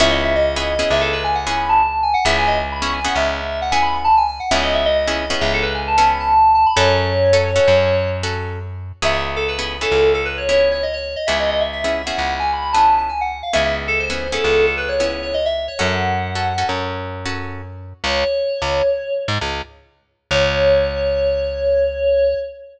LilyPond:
<<
  \new Staff \with { instrumentName = "Electric Piano 2" } { \time 5/4 \key cis \minor \tempo 4 = 133 e''16 dis''16 e''16 dis''4~ dis''16 e''16 a'16 b'16 gis''16 fis''16 gis''16 b''16 a''8. gis''16 fis''16 | e''16 gis''16 dis''16 r16 b''16 cis'''16 gis''16 fis''16 e''4 fis''16 gis''16 b''16 b''16 a''16 gis''16 gis''16 fis''16 | e''16 dis''16 e''16 dis''4~ dis''16 e''16 a'16 b'16 gis''16 a''16 a''16 b''16 a''8. a''16 b''16 | cis''2. r2 |
e''16 e''16 r16 a'16 b'8. a'8. a'16 b'16 cis''16 cis''8 cis''16 dis''16 cis''8 dis''16 | e''16 dis''16 dis''16 e''16 e''8. fis''8. gis''16 b''16 b''16 a''8 a''16 gis''16 fis''8 f''16 | e''16 e''16 r16 a'16 bis'8. a'8. a'16 b'16 cis''16 cis''8 cis''16 dis''16 e''8 cis''16 | fis''2 r2. |
cis''2~ cis''8 r2 r8 | cis''1~ cis''4 | }
  \new Staff \with { instrumentName = "Acoustic Guitar (steel)" } { \time 5/4 \key cis \minor <b cis' e' gis'>4~ <b cis' e' gis'>16 <b cis' e' gis'>8 <b cis' e' gis'>4. <b cis' e' gis'>4.~ <b cis' e' gis'>16 | <b cis' e' gis'>4~ <b cis' e' gis'>16 <b cis' e' gis'>8 <b cis' e' gis'>4. <b cis' e' gis'>4.~ <b cis' e' gis'>16 | <b cis' e' gis'>4~ <b cis' e' gis'>16 <b cis' e' gis'>8 <b cis' e' gis'>4. <b cis' e' gis'>4.~ <b cis' e' gis'>16 | <cis' fis' a'>4~ <cis' fis' a'>16 <cis' fis' a'>8 <cis' fis' a'>4. <cis' fis' a'>4.~ <cis' fis' a'>16 |
<b cis' e' gis'>4~ <b cis' e' gis'>16 <b cis' e' gis'>8 <b cis' e' gis'>4. <b cis' e' gis'>4.~ <b cis' e' gis'>16 | <b cis' e' gis'>4~ <b cis' e' gis'>16 <b cis' e' gis'>8 <b cis' e' gis'>4. <b cis' e' gis'>4.~ <b cis' e' gis'>16 | <b cis' e' gis'>4~ <b cis' e' gis'>16 <b cis' e' gis'>8 <b cis' e' gis'>4. <b cis' e' gis'>4.~ <b cis' e' gis'>16 | <cis' fis' a'>4~ <cis' fis' a'>16 <cis' fis' a'>8 <cis' fis' a'>4. <cis' fis' a'>4.~ <cis' fis' a'>16 |
r1 r4 | r1 r4 | }
  \new Staff \with { instrumentName = "Electric Bass (finger)" } { \clef bass \time 5/4 \key cis \minor cis,2 cis,2. | cis,2 cis,2. | cis,2 cis,2. | fis,2 fis,2. |
cis,2 cis,2. | cis,2 cis,2. | cis,2 cis,2. | fis,2 fis,2. |
cis,4~ cis,16 cis,4. gis,16 cis,2 | cis,1~ cis,4 | }
>>